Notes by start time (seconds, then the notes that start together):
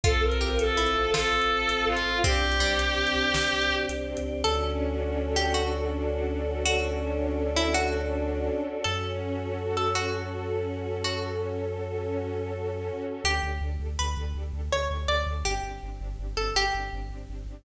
0.03 A1 C4 F4 A4, kick, closed hi-hat
0.22 A1 A#4
0.31 C4 F4 A4, closed hi-hat
0.41 A1 G4
0.59 A1 C4 F4 A4, closed hi-hat
0.68 C4 F4 A4
0.76 A1 C4 E4 F4 A4
0.86 closed hi-hat
0.96 A1
1.13 A1 F4 A4, snare
1.33 A1
1.42 closed hi-hat
1.52 A1
1.69 A1, closed hi-hat
1.77 C4 F4 A4
1.86 A1 F4
1.97 closed hi-hat
2.05 A1 C4 F4 A4
2.14 C4 F4 A4
2.24 C2 C4 D4 G4, kick, closed hi-hat
2.43 C2
2.52 C4 D4 G4, closed hi-hat
2.60 C2 G3
2.78 C2 C4 D4 G4, closed hi-hat
2.88 C4 D4 G4
2.97 C2 C4 D4 G4
3.07 closed hi-hat
3.15 C2
3.34 C2, snare
3.53 C2
3.62 closed hi-hat
3.70 C2
3.89 C2, closed hi-hat
3.99 C4 D4 G4
4.17 C#2, closed hi-hat
4.26 C4 D4 G4
4.35 C4 D4 G4
4.44 D2 C#4 D4 F#4 A4
4.62 D4
4.81 F#4
5.00 A4
5.18 F#4
5.36 D4 G4
5.54 C#4 F#4
5.72 D4
5.90 F#4
6.09 A4
6.27 F#4
6.46 D4
6.65 C#4 D4 F#4 A4 C#5
6.83 D4
7.00 F#4
7.19 A4
7.38 F#4
7.55 D4 E4
7.74 C#4 F#4
7.93 D4
8.11 F#4
8.30 A4
8.48 F#4
8.66 D4
8.84 F#2 C#4 F#4 A4
9.03 F#4
9.22 A4
9.40 F#4
9.58 C#4
9.77 F#4 A4
9.94 F#4 A4
10.13 F#4
10.32 C#4
10.50 F#4
10.68 A4
10.87 F#4
11.04 C#4 F#4 A4 C#5
11.23 F#4
11.42 A4
11.60 F#4
11.78 C#4
11.96 F#4
12.15 A4
12.33 F#4
12.51 C#4
12.70 F#4
12.89 A4
13.07 F#4
13.24 D2 D4 G4 A4
13.43 D2 D4 G4 A4
13.61 D2 D4 G4 A4
13.80 D2 D4 G4 A4
13.99 D2 D4 G4 A4 B4
14.17 D2 D4 G4 A4
14.35 D2 D4 G4 A4
14.53 D2 D4 G4 A4
14.71 D2 D4 G4 A4 C#5
14.90 D2 D4 G4 A4
15.08 D2 D4 G4 A4 D5
15.26 D2 D4 G4 A4
15.44 G1 C4 D4 G4
15.63 G1 C4 D4 G4
15.82 G1 C4 D4 G4
16.00 G1 C4 D4 G4
16.19 G1 C4 D4 G4
16.36 G1 C4 D4 G4 A4
16.55 G1 C4 D4 G4
16.73 G1 C4 D4 G4
16.92 G1 C4 D4 G4
17.09 G1 C4 D4 G4
17.28 G1 C4 D4 G4
17.46 G1 C4 D4 G4